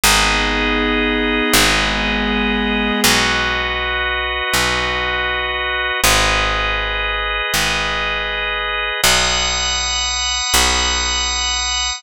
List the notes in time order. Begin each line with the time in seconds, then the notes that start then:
0.04 G#1 B3 D#4 G#4 B4 D#5
1.54 G#1 G#3 B3 G#4
3.04 B1 F#4 B4 D#5
4.54 B1
6.04 G#1 G#4 B4 D#5
7.54 G#1
9.03 B1 F#5 B5 D#6
10.54 B1